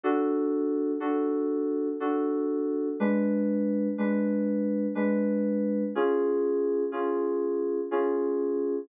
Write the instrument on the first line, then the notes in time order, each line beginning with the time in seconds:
electric piano 2
0.03 D4 F#4 A4
1.00 D4 F#4 A4
2.00 D4 F#4 A4
3.00 G#3 D4 B4
3.98 G#3 D4 B4
4.95 G#3 D4 B4
5.95 C#4 F4 G#4
6.92 C#4 F4 G#4
7.91 C#4 F4 G#4